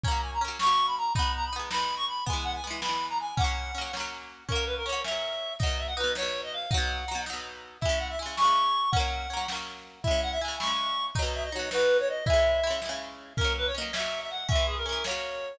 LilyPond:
<<
  \new Staff \with { instrumentName = "Clarinet" } { \time 6/8 \key fis \mixolydian \tempo 4. = 108 ais''8 gis''16 ais''16 r8 cis'''8. b''16 ais''8 | b''8 ais''16 b''16 r8 b''8. cis'''16 b''8 | gis''8 fis''16 gis''16 r8 b''8. ais''16 gis''8 | fis''4. r4. |
ais'8 b'16 ais'16 cis''8 e''4. | dis''8 e''16 fis''16 b'8 cis''8. dis''16 eis''8 | fis''4. r4. | e''8 fis''16 e''16 gis''8 cis'''4. |
fis''2 r4 | e''8 fis''16 e''16 gis''8 cis'''4. | dis''8 e''16 dis''16 cis''8 b'8. cis''16 dis''8 | e''4. r4. |
ais'8 b'16 cis''16 dis''8 e''8. e''16 fis''8 | e''8 gis'16 ais'16 ais'8 cis''4. | }
  \new Staff \with { instrumentName = "Orchestral Harp" } { \time 6/8 \key fis \mixolydian <fis ais cis'>4 <fis ais cis'>8 <fis ais cis'>4. | <gis b dis'>4 <gis b dis'>8 <gis b dis'>4. | <e gis b>4 <e gis b>8 <e gis b>4. | <fis ais cis'>4 <fis ais cis'>8 <fis ais cis'>4. |
<fis ais cis'>4 <fis ais cis'>8 <fis ais cis'>4. | <b, fis dis'>4 <b, fis dis'>8 <b, fis dis'>4. | <b, fis dis'>4 <b, fis dis'>8 <b, fis dis'>4. | <cis gis e'>4 <cis gis e'>8 <cis gis e'>4. |
<fis ais cis'>4 <fis ais cis'>8 <fis ais cis'>4. | <cis gis e'>4 <cis gis e'>8 <cis gis e'>4. | <b, fis dis'>4 <b, fis dis'>8 <b, fis dis'>4. | <cis gis e'>4 <cis gis e'>8 <cis gis e'>4. |
<fis ais cis'>4 <fis ais cis'>8 <fis ais cis'>4. | <e gis cis'>4 <e gis cis'>8 <fis ais cis'>4. | }
  \new DrumStaff \with { instrumentName = "Drums" } \drummode { \time 6/8 <hh bd>8. hh8. sn8. hh8. | <hh bd>8. hh8. sn8. hh8. | <hh bd>8. hh8. sn8. hh8. | <hh bd>8. hh8. sn8. hh8. |
<hh bd>8. hh8. sn8. hh8. | <hh bd>8. hh8. sn8. hh8. | <hh bd>8. hh8. sn8. hh8. | <hh bd>8. hh8. sn8. hh8. |
<hh bd>8. hh8. sn8. hh8. | <hh bd>8. hh8. sn8. hh8. | <hh bd>8. hh8. sn8. hh8. | <hh bd>8. hh8. sn8. hh8. |
<hh bd>8. hh8. sn8. hh8. | <hh bd>8. hh8. sn8. hh8. | }
>>